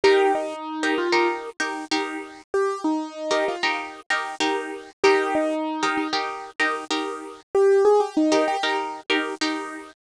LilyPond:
<<
  \new Staff \with { instrumentName = "Acoustic Grand Piano" } { \time 4/4 \key ees \major \tempo 4 = 96 g'8 ees'4 f'8 r2 | g'8 ees'4 f'8 r2 | g'8 ees'4 ees'8 r2 | g'8 aes'16 g'16 ees'8 g'8 r2 | }
  \new Staff \with { instrumentName = "Pizzicato Strings" } { \time 4/4 \key ees \major <ees' g' bes'>4~ <ees' g' bes'>16 <ees' g' bes'>8 <ees' g' bes'>8. <ees' g' bes'>8 <ees' g' bes'>4~ | <ees' g' bes'>4~ <ees' g' bes'>16 <ees' g' bes'>8 <ees' g' bes'>8. <ees' g' bes'>8 <ees' g' bes'>4 | <ees' g' bes'>4~ <ees' g' bes'>16 <ees' g' bes'>8 <ees' g' bes'>8. <ees' g' bes'>8 <ees' g' bes'>4~ | <ees' g' bes'>4~ <ees' g' bes'>16 <ees' g' bes'>8 <ees' g' bes'>8. <ees' g' bes'>8 <ees' g' bes'>4 | }
>>